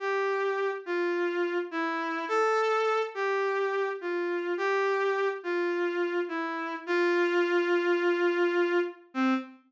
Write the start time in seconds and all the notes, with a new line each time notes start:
0.00 G4
0.86 F4
1.71 E4
2.28 A4
3.15 G4
4.01 F4
4.58 G4
5.43 F4
6.28 E4
6.86 F4
9.14 C4